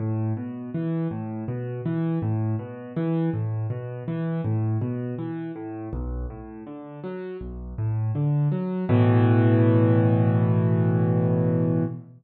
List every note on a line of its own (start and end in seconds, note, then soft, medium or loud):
0.00 0.33 A2 medium
0.37 0.70 B2 medium
0.74 1.08 E3 medium
1.11 1.44 A2 medium
1.48 1.81 B2 medium
1.85 2.19 E3 medium
2.22 2.56 A2 medium
2.59 2.92 B2 medium
2.96 3.30 E3 medium
3.33 3.67 A2 medium
3.70 4.03 B2 medium
4.08 4.41 E3 medium
4.44 4.78 A2 medium
4.81 5.15 B2 medium
5.18 5.52 E3 medium
5.56 5.89 A2 medium
5.93 6.26 B1 medium
6.30 6.63 A2 medium
6.67 7.00 D3 medium
7.04 7.37 F#3 medium
7.41 7.74 B1 medium
7.78 8.12 A2 medium
8.15 8.48 D3 medium
8.52 8.85 F#3 medium
8.89 11.84 A2 loud
8.89 11.84 B2 loud
8.89 11.84 E3 loud